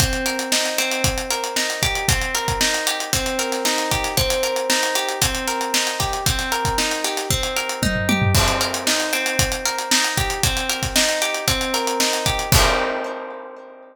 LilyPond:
<<
  \new Staff \with { instrumentName = "Acoustic Guitar (steel)" } { \time 4/4 \key c \minor \tempo 4 = 115 c'8 bes'8 ees'8 c'4 bes'8 ees'8 g'8 | c'8 bes'8 ees'8 g'8 c'8 bes'8 ees'8 g'8 | c'8 bes'8 ees'8 g'8 c'8 bes'8 ees'8 g'8 | c'8 bes'8 ees'8 g'8 c'8 bes'8 ees'8 g'8 |
c'8 bes'8 ees'8 c'4 bes'8 ees'8 g'8 | c'8 bes'8 ees'8 g'8 c'8 bes'8 ees'8 g'8 | <c' ees' g' bes'>1 | }
  \new DrumStaff \with { instrumentName = "Drums" } \drummode { \time 4/4 <hh bd>16 hh16 hh16 hh16 sn16 <hh sn>16 <hh sn>16 hh16 <hh bd>16 hh16 hh16 hh16 sn16 hh16 <hh bd>16 hh16 | <hh bd>16 hh16 hh16 <hh bd>16 sn16 <hh sn>16 hh16 hh16 <hh bd>16 hh16 hh16 <hh sn>16 sn16 <hh sn>16 <hh bd sn>16 <hh sn>16 | <hh bd>16 hh16 hh16 hh16 sn16 <hh sn>16 hh16 hh16 <hh bd>16 hh16 <hh sn>16 hh16 sn16 hh16 <hh bd sn>16 hh16 | <hh bd>16 <hh sn>16 hh16 <hh bd>16 sn16 hh16 <hh sn>16 <hh sn>16 bd16 hh16 hh16 hh16 <bd tommh>16 tomfh16 tommh16 tomfh16 |
<cymc bd>16 hh16 hh16 hh16 sn16 hh16 hh16 hh16 <hh bd>16 hh16 hh16 hh16 sn16 hh16 <hh bd>16 hh16 | <hh bd>16 hh16 hh16 <hh bd sn>16 sn16 hh16 hh16 hh16 <hh bd>16 hh16 <hh sn>16 hh16 sn16 <hh sn>16 <hh bd>16 hh16 | <cymc bd>4 r4 r4 r4 | }
>>